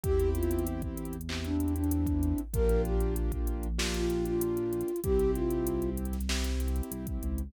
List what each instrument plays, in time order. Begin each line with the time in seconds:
0.03 synth bass 1 E2, acoustic grand piano C4 E4 G4, flute G4, kick, closed hi-hat
0.20 closed hi-hat
0.35 flute F4, closed hi-hat
0.43 closed hi-hat
0.51 closed hi-hat
0.59 closed hi-hat
0.67 closed hi-hat
0.82 kick, closed hi-hat
0.97 closed hi-hat
1.05 closed hi-hat
1.13 closed hi-hat
1.21 closed hi-hat
1.29 acoustic grand piano C4 E4 G4, clap
1.44 flute D4, closed hi-hat
1.60 closed hi-hat
1.68 closed hi-hat
1.76 flute D4, closed hi-hat
1.84 closed hi-hat
1.91 closed hi-hat
2.07 kick, closed hi-hat
2.23 closed hi-hat
2.38 closed hi-hat
2.54 synth bass 1 A#1, acoustic grand piano A#3 D4 F4 G4, flute A#4, kick, closed hi-hat
2.69 closed hi-hat
2.85 flute G4, closed hi-hat
3.00 closed hi-hat
3.16 closed hi-hat
3.32 kick, closed hi-hat
3.47 closed hi-hat
3.63 closed hi-hat
3.78 acoustic grand piano A#3 D4 F4 G4, snare
3.94 flute F4, closed hi-hat
4.10 closed hi-hat
4.25 flute F4, closed hi-hat
4.41 closed hi-hat
4.57 closed hi-hat
4.73 closed hi-hat
4.81 closed hi-hat
4.88 closed hi-hat
4.96 closed hi-hat
5.03 synth bass 1 C2, acoustic grand piano C4 E4 G4, flute G4, kick, closed hi-hat
5.19 closed hi-hat
5.35 flute F4, closed hi-hat
5.51 closed hi-hat
5.67 closed hi-hat
5.82 closed hi-hat
5.97 closed hi-hat
6.05 closed hi-hat
6.13 snare, closed hi-hat
6.21 closed hi-hat
6.29 acoustic grand piano C4 E4 G4, snare
6.44 snare, closed hi-hat
6.60 closed hi-hat
6.68 closed hi-hat
6.76 closed hi-hat
6.83 closed hi-hat
6.91 synth bass 1 C2, closed hi-hat
7.07 kick, closed hi-hat
7.23 synth bass 1 C#2, closed hi-hat
7.38 closed hi-hat